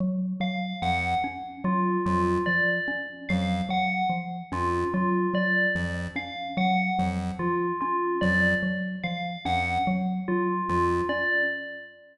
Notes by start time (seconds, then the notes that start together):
0.00 F#3
0.40 F#3 F5
0.82 F2 F3 F#5
1.24 C#4
1.64 F#3 F4
2.06 F2 F#3 F4
2.46 F3 D5
2.88 C#4
3.29 F2 F#3 F5
3.69 F#3 F#5
4.10 F3
4.52 F2 C#4 F4
4.94 F#3 F4
5.34 F#3 D5
5.75 F2 F3
6.16 C#4 F5
6.57 F#3 F#5
6.99 F2 F#3
7.39 F3 F4
7.81 C#4 F4
8.21 F2 F#3 D5
8.63 F#3
9.04 F3 F5
9.45 F2 C#4 F#5
9.87 F#3
10.28 F#3 F4
10.69 F2 F3 F4
11.09 C#4 D5